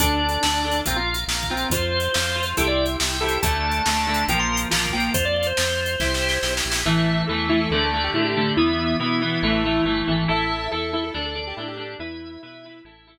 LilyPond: <<
  \new Staff \with { instrumentName = "Drawbar Organ" } { \time 4/4 \key d \minor \tempo 4 = 140 d'2 c'16 f'8 r8. c'8 | c''2 a'16 d''8 r8. a'8 | a''2 g''16 c'''8 r8. g''8 | c''16 d''16 d''16 c''2~ c''8. r8 |
\key a \minor r1 | r1 | r1 | r1 | }
  \new Staff \with { instrumentName = "Lead 1 (square)" } { \time 4/4 \key d \minor r1 | r1 | r1 | r1 |
\key a \minor e''4 a'8 e'16 a'16 a'16 a'8 g'16 e'16 g'8. | e'1 | e''4 a'8 e'16 a'16 a'16 a'8 g'16 e'16 g'8. | e'2 r2 | }
  \new Staff \with { instrumentName = "Overdriven Guitar" } { \time 4/4 \key d \minor <d' a'>4 <d' a'>8 <d' a'>8 <f' bes'>4. <f' bes'>8 | <f' c''>4 <f' c''>8 <f' c''>8 <e' g' c''>4. <e' g' c''>8 | <d a>4 <d a>8 <d a>8 <f bes>4 <f bes>8 <f bes>8 | r1 |
\key a \minor <e a>4 <e a>8 <e a>8 <d a>8 <d a>8 <d a>8 <d a>8 | <e b>4 <e b>8 <e b>8 <e a>8 <e a>8 <e a>8 <e a>8 | <e' a'>4 <e' a'>8 <e' a'>8 <d' a'>8 <d' a'>8 <d' a'>8 <d' a'>8 | <e' b'>4 <e' b'>8 <e' b'>8 <e' a'>8 <e' a'>8 r4 | }
  \new Staff \with { instrumentName = "Drawbar Organ" } { \time 4/4 \key d \minor <d'' a''>4 <d'' a''>4 <f'' bes''>4 <f'' bes''>4 | <f'' c'''>4 <f'' c'''>4 <e'' g'' c'''>4 <e'' g'' c'''>4 | <d' a'>4 <d' a'>4 <f' bes'>4 <f' bes'>4 | <f' c''>4 <f' c''>4 <e' g' c''>4 <e' g' c''>4 |
\key a \minor <e'' a''>4 <e'' a''>4 <d'' a''>4 <d'' a''>4 | <e'' b''>4 <e'' b''>4 <e'' a''>4 <e'' a''>4 | <e'' a''>4 <e'' a''>4 <d'' a''>4 <d'' a''>4 | <e'' b''>4 <e'' b''>4 <e'' a''>4 r4 | }
  \new Staff \with { instrumentName = "Synth Bass 1" } { \clef bass \time 4/4 \key d \minor d,4 d,4 bes,,4 bes,,4 | f,4 f,4 c,4 c,4 | d,4 d,4 bes,,4 bes,,4 | f,4 f,4 c,4 b,,8 bes,,8 |
\key a \minor a,,4 e,4 d,4 a,4 | e,4 b,4 a,,4 g,,8 gis,,8 | a,,4 e,4 d,4 a,4 | e,4 b,4 a,,4 r4 | }
  \new DrumStaff \with { instrumentName = "Drums" } \drummode { \time 4/4 \tuplet 3/2 { <hh bd>8 r8 hh8 sn8 r8 hh8 <hh bd>8 r8 hh8 sn8 bd8 hh8 } | \tuplet 3/2 { <hh bd>8 r8 hh8 sn8 r8 hh8 <hh bd>8 r8 hh8 sn8 r8 hh8 } | \tuplet 3/2 { <hh bd>8 r8 hh8 sn8 r8 hh8 <hh bd>8 r8 hh8 sn8 bd8 hh8 } | \tuplet 3/2 { <hh bd>8 r8 hh8 sn8 r8 hh8 <bd sn>8 sn8 sn8 sn8 sn8 sn8 } |
r4 r4 r4 r4 | r4 r4 r4 r4 | r4 r4 r4 r4 | r4 r4 r4 r4 | }
>>